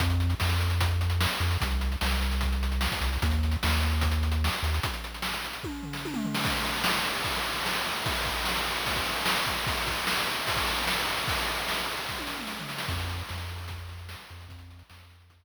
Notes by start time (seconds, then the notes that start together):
0.00 F2, kick, closed hi-hat
0.10 closed hi-hat
0.20 closed hi-hat
0.30 closed hi-hat
0.40 F2, snare
0.49 closed hi-hat
0.60 closed hi-hat
0.70 closed hi-hat
0.81 kick, closed hi-hat
0.91 closed hi-hat
1.01 closed hi-hat
1.10 closed hi-hat
1.21 snare
1.31 closed hi-hat
1.40 F2, closed hi-hat
1.51 closed hi-hat
1.61 C2, kick, closed hi-hat
1.71 closed hi-hat
1.81 closed hi-hat
1.92 closed hi-hat
2.01 C2, snare
2.11 closed hi-hat
2.21 closed hi-hat
2.31 closed hi-hat
2.41 kick, closed hi-hat
2.52 closed hi-hat
2.63 closed hi-hat
2.72 closed hi-hat
2.81 snare
2.92 kick, closed hi-hat
3.01 C2, closed hi-hat
3.13 open hi-hat
3.22 D#2, kick, closed hi-hat
3.31 closed hi-hat
3.43 closed hi-hat
3.52 closed hi-hat
3.63 D#2, snare
3.72 closed hi-hat
3.82 closed hi-hat
3.92 closed hi-hat
4.01 kick, closed hi-hat
4.11 closed hi-hat
4.23 closed hi-hat
4.32 closed hi-hat
4.44 snare
4.52 closed hi-hat
4.63 D#2, closed hi-hat
4.74 closed hi-hat
4.83 kick, closed hi-hat
4.94 closed hi-hat
5.04 closed hi-hat
5.14 closed hi-hat
5.22 snare
5.34 closed hi-hat
5.44 closed hi-hat
5.53 closed hi-hat
5.64 kick, high tom
5.83 floor tom
5.93 snare
6.05 high tom
6.14 mid tom
6.25 floor tom
6.34 snare
6.44 kick, crash
6.54 ride
6.65 ride
6.73 ride
6.84 snare
6.94 ride
7.05 ride
7.15 ride
7.24 kick, ride
7.34 ride
7.44 ride
7.56 ride
7.66 snare
7.74 ride
7.85 ride
7.96 ride
8.06 kick, ride
8.16 ride
8.25 kick, ride
8.36 ride
8.45 snare
8.56 ride
8.66 ride
8.76 ride
8.86 kick, ride
8.96 kick, ride
9.05 ride
9.16 ride
9.26 snare
9.36 ride
9.46 kick, ride
9.57 ride
9.67 kick, ride
9.77 ride
9.87 kick, ride
9.97 ride
10.07 snare
10.17 ride
10.27 ride
10.37 ride
10.47 kick, ride
10.56 kick, ride
10.66 ride
10.78 ride
10.87 snare
10.96 ride
11.07 ride
11.17 ride
11.28 kick, ride
11.37 ride
11.48 ride
11.57 ride
11.68 snare
11.78 ride
11.88 ride
11.97 ride
12.09 kick, snare
12.18 high tom
12.27 snare
12.39 mid tom
12.47 snare
12.59 floor tom
12.69 snare
12.78 snare
12.88 F2, kick, crash
13.00 closed hi-hat
13.09 closed hi-hat
13.19 closed hi-hat
13.29 F2, snare
13.39 closed hi-hat
13.48 closed hi-hat
13.58 closed hi-hat
13.68 kick, closed hi-hat
13.78 closed hi-hat
13.89 closed hi-hat
13.99 closed hi-hat
14.09 snare
14.18 closed hi-hat
14.29 F2, closed hi-hat
14.40 closed hi-hat
14.48 F2, kick, closed hi-hat
14.59 closed hi-hat
14.70 closed hi-hat
14.79 closed hi-hat
14.90 F2, snare
15.00 closed hi-hat
15.10 closed hi-hat
15.20 closed hi-hat
15.30 kick, closed hi-hat
15.40 closed hi-hat